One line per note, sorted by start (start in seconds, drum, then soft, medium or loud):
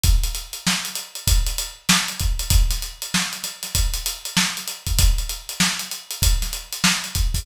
0.03 kick medium
0.03 closed hi-hat medium
0.23 closed hi-hat medium
0.35 closed hi-hat medium
0.53 closed hi-hat medium
0.67 snare loud
0.85 closed hi-hat medium
0.95 closed hi-hat medium
1.15 closed hi-hat medium
1.27 kick medium
1.27 closed hi-hat loud
1.47 closed hi-hat medium
1.58 closed hi-hat medium
1.89 snare loud
1.89 closed hi-hat medium
2.08 closed hi-hat medium
2.19 kick medium
2.19 closed hi-hat medium
2.39 closed hi-hat medium
2.50 kick medium
2.50 closed hi-hat loud
2.70 snare soft
2.70 closed hi-hat medium
2.82 closed hi-hat medium
3.02 closed hi-hat medium
3.14 snare loud
3.33 closed hi-hat medium
3.43 snare soft
3.43 closed hi-hat medium
3.63 snare soft
3.63 closed hi-hat medium
3.75 kick medium
3.75 closed hi-hat loud
3.94 closed hi-hat medium
4.06 closed hi-hat medium
4.25 closed hi-hat medium
4.37 snare loud
4.57 closed hi-hat medium
4.68 closed hi-hat medium
4.86 kick medium
4.86 closed hi-hat medium
4.99 kick medium
4.99 closed hi-hat loud
5.18 closed hi-hat medium
5.29 closed hi-hat medium
5.49 closed hi-hat medium
5.60 snare loud
5.79 closed hi-hat medium
5.91 closed hi-hat medium
6.11 closed hi-hat medium
6.22 kick medium
6.22 closed hi-hat loud
6.42 snare soft
6.42 closed hi-hat medium
6.53 closed hi-hat medium
6.73 closed hi-hat medium
6.84 snare loud
7.04 closed hi-hat medium
7.15 kick medium
7.15 closed hi-hat medium
7.34 kick medium
7.34 open hi-hat medium